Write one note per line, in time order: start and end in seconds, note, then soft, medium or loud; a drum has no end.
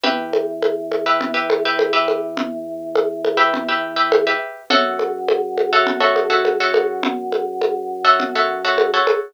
0.04 4.34 E2 loud
0.04 0.50 G4 medium
0.04 0.50 B4 loud
0.04 0.50 E5 medium
0.04 low conga loud
0.33 high conga medium
0.62 high conga medium
0.92 high conga medium
1.06 1.29 G4 medium
1.06 1.29 B4 medium
1.06 1.29 E5 medium
1.21 low conga loud
1.34 1.57 G4 medium
1.34 1.57 B4 medium
1.34 1.57 E5 medium
1.50 high conga loud
1.65 1.89 G4 medium
1.65 1.89 B4 medium
1.65 1.89 E5 medium
1.79 high conga loud
1.93 2.40 G4 medium
1.93 2.40 B4 medium
1.93 2.40 E5 medium
2.08 high conga medium
2.37 low conga loud
2.96 high conga loud
3.25 high conga medium
3.37 3.61 G4 medium
3.37 3.61 B4 medium
3.37 3.61 E5 medium
3.54 low conga loud
3.69 3.92 G4 medium
3.69 3.92 B4 medium
3.69 3.92 E5 medium
3.96 4.20 G4 medium
3.96 4.20 B4 medium
3.96 4.20 E5 medium
4.12 high conga loud
4.27 4.62 G4 medium
4.27 4.62 B4 medium
4.27 4.62 E5 medium
4.70 8.99 F#2 loud
4.70 5.17 F#4 loud
4.70 5.17 A4 loud
4.70 5.17 C#5 loud
4.70 5.17 E5 loud
4.70 low conga loud
4.99 high conga medium
5.29 high conga loud
5.58 high conga medium
5.73 5.96 F#4 loud
5.73 5.96 A4 loud
5.73 5.96 C#5 medium
5.73 5.96 E5 medium
5.87 low conga loud
6.00 6.24 F#4 medium
6.00 6.24 A4 medium
6.00 6.24 C#5 medium
6.00 6.24 E5 medium
6.16 high conga medium
6.30 6.53 F#4 medium
6.30 6.53 A4 medium
6.30 6.53 C#5 medium
6.30 6.53 E5 medium
6.45 high conga medium
6.60 7.07 F#4 medium
6.60 7.07 A4 medium
6.60 7.07 C#5 medium
6.60 7.07 E5 medium
6.74 high conga loud
7.03 low conga loud
7.32 high conga medium
7.62 high conga medium
8.05 8.28 F#4 medium
8.05 8.28 A4 medium
8.05 8.28 C#5 medium
8.05 8.28 E5 medium
8.20 low conga loud
8.35 8.59 F#4 medium
8.35 8.59 A4 medium
8.35 8.59 C#5 medium
8.35 8.59 E5 medium
8.65 8.88 F#4 loud
8.65 8.88 A4 medium
8.65 8.88 C#5 medium
8.65 8.88 E5 medium
8.78 high conga loud
8.94 9.29 F#4 medium
8.94 9.29 A4 medium
8.94 9.29 C#5 medium
8.94 9.29 E5 medium
9.07 high conga loud